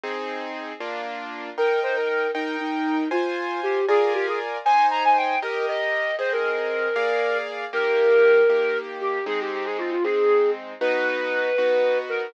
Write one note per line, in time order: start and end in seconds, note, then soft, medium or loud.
0.04 0.73 C4 loud
0.04 0.73 D#4 medium
0.04 0.73 G#4 medium
0.80 1.50 A#3 medium
0.80 1.50 D4 medium
0.80 1.50 F4 medium
1.58 2.27 D#4 medium
1.58 2.27 A#4 medium
1.58 1.79 A#4 loud
1.58 2.27 G5 medium
1.83 1.95 C5 medium
1.96 2.08 A#4 loud
2.09 2.31 A#4 medium
2.35 2.56 D#4 loud
2.35 3.04 D#4 medium
2.35 3.04 A#4 medium
2.35 3.04 G5 medium
2.60 3.08 D#4 loud
3.11 3.80 F4 medium
3.11 3.60 F4 loud
3.11 3.80 C5 medium
3.11 3.80 G#5 medium
3.63 3.85 G4 loud
3.88 4.58 F4 medium
3.88 4.13 G#4 loud
3.88 4.58 A#4 medium
3.88 4.58 D5 medium
3.88 4.58 G#5 medium
4.14 4.26 G4 loud
4.27 4.39 G#4 medium
4.65 5.35 D#4 medium
4.65 5.35 C5 medium
4.65 4.86 G#5 loud
4.65 5.35 G#5 medium
4.91 5.03 A#5 loud
5.04 5.17 G#5 medium
5.17 5.39 G5 medium
5.42 6.12 G4 medium
5.42 5.66 A#4 medium
5.42 6.12 A#4 medium
5.42 6.12 D#5 medium
5.68 6.15 D#5 medium
6.19 6.88 C4 medium
6.19 6.88 G#4 medium
6.19 6.31 C5 loud
6.19 6.88 D#5 medium
6.32 7.37 A#4 loud
6.96 7.65 A#3 medium
6.96 7.65 G#4 medium
6.96 7.65 D5 medium
6.96 7.65 F5 medium
7.73 8.42 D#3 medium
7.73 8.42 A#3 loud
7.73 8.42 G4 loud
7.73 8.77 A#4 loud
8.50 9.19 D#3 medium
8.50 9.19 A#3 medium
8.50 9.19 G4 medium
9.01 9.25 G4 loud
9.26 9.95 G#3 loud
9.26 9.95 C4 loud
9.26 9.95 D#4 medium
9.26 9.39 G#4 loud
9.40 9.52 G4 loud
9.53 9.65 G4 loud
9.65 9.77 G#4 loud
9.78 9.90 F4 loud
9.91 10.03 F4 loud
10.04 10.74 G#3 medium
10.04 10.74 C4 medium
10.04 10.74 D#4 medium
10.04 10.50 G#4 loud
10.81 11.50 B3 medium
10.81 11.50 D#4 loud
10.81 11.50 F#4 loud
10.81 11.97 B4 loud
11.58 12.27 B3 medium
11.58 12.27 D#4 medium
11.58 12.27 F#4 medium
12.09 12.30 A#4 loud